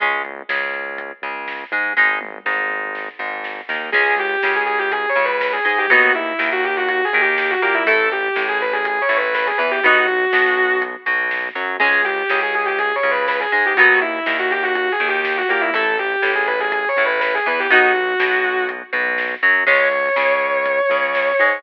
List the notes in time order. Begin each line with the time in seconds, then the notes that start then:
0.00 C#2 G#3 C#4, kick, closed hi-hat
0.25 closed hi-hat
0.49 C#2 C#3, snare
0.74 closed hi-hat
0.98 kick, closed hi-hat
1.22 C#2 C#3, closed hi-hat
1.48 snare
1.72 G#2 G#3, closed hi-hat
1.97 G#1 G#3 D#4, kick, snare
2.21 high tom
2.45 G#1 G#2, snare
2.70 mid tom
2.95 snare
3.19 G#1 G#2, floor tom
3.44 snare
3.69 D#2 D#3, snare
3.92 C#2 G#3 C#4 G#4, kick, crash
4.18 G4, closed hi-hat
4.43 C#2 C#3, snare
4.56 G#4
4.66 G#4, closed hi-hat
4.78 G4
4.92 G#4, kick, closed hi-hat
5.09 C#5
5.15 C#2 C#3, closed hi-hat
5.25 B4
5.41 B4, snare
5.53 G#4
5.65 G#2 G#3 G#4, closed hi-hat
5.78 G4
5.90 D#2 F#3 B3 D#4 F#4, kick, closed hi-hat
6.15 E4, closed hi-hat
6.39 D#2 D#3, snare
6.52 F#4
6.64 G4, closed hi-hat
6.76 F#4
6.88 F#4, kick, closed hi-hat
7.05 G#4
7.13 D#2 D#3, closed hi-hat
7.21 G4
7.38 G4, snare
7.50 F#4
7.62 A#2 A#3 G4, closed hi-hat
7.74 E4
7.86 A1 A3 E4 A4, kick, closed hi-hat
8.11 G4, closed hi-hat
8.36 A1 A2, snare
8.48 G#4
8.61 B4, closed hi-hat
8.73 G#4
8.85 G#4, kick, closed hi-hat
9.01 C#5
9.09 A1 A2, closed hi-hat
9.17 B4
9.34 B4, snare
9.47 G#4
9.58 E2 E3 B4, closed hi-hat
9.71 G4
9.83 B1 B3 D#4 F#4, kick, closed hi-hat
10.08 closed hi-hat
10.33 B1 B2, snare
10.57 closed hi-hat
10.82 kick, closed hi-hat
11.06 B1 B2, closed hi-hat
11.31 snare
11.55 F#2 F#3, closed hi-hat
11.80 C#2 G#3 C#4 G#4, kick, crash
12.05 G4, closed hi-hat
12.30 C#2 C#3, snare
12.42 G#4
12.54 G#4, closed hi-hat
12.65 G4
12.79 G#4, kick, closed hi-hat
12.95 C#5
13.03 C#2 C#3, closed hi-hat
13.11 B4
13.28 B4, snare
13.40 G#4
13.52 G#2 G#3 G#4, closed hi-hat
13.66 G4
13.77 D#2 F#3 B3 D#4 F#4, kick, closed hi-hat
14.01 E4, closed hi-hat
14.26 D#2 D#3, snare
14.39 F#4
14.51 G4, closed hi-hat
14.63 F#4
14.75 F#4, kick, closed hi-hat
14.92 G#4
15.00 D#2 D#3, closed hi-hat
15.08 G4
15.24 G4, snare
15.38 F#4
15.48 A#2 A#3 G4, closed hi-hat
15.61 E4
15.73 A1 A3 E4 A4, kick, closed hi-hat
15.98 G4, closed hi-hat
16.22 A1 A2, snare
16.35 G#4
16.47 B4, closed hi-hat
16.60 G#4
16.72 G#4, kick, closed hi-hat
16.88 C#5
16.96 A1 A2, closed hi-hat
17.05 B4
17.20 B4, snare
17.35 G#4
17.46 E2 E3 B4, closed hi-hat
17.60 G4
17.70 B1 B3 D#4 F#4, kick, closed hi-hat
17.95 closed hi-hat
18.19 B1 B2, snare
18.44 closed hi-hat
18.69 kick, closed hi-hat
18.93 B1 B2, closed hi-hat
19.18 snare
19.43 F#2 F#3, closed hi-hat
19.67 C#2 G#3 C#4 C#5, kick, crash
19.92 closed hi-hat
20.16 C#2 C#3, snare
20.41 closed hi-hat
20.66 kick, closed hi-hat
20.90 C#2 C#3, closed hi-hat
21.15 snare
21.39 G#2 G#3, closed hi-hat